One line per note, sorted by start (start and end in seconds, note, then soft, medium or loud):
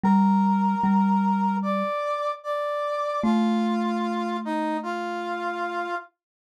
0.04 0.75 G3 medium
0.04 1.56 A#4 medium
0.04 1.56 A#5 medium
0.84 1.83 G3 medium
1.62 2.32 D5 medium
1.62 2.32 D6 medium
2.43 3.21 D5 medium
2.43 3.21 D6 medium
3.22 5.87 A3 medium
3.22 4.37 F4 medium
3.22 4.37 F5 medium
4.45 4.77 D#4 medium
4.45 4.77 D#5 medium
4.83 5.95 F4 medium
4.83 5.95 F5 medium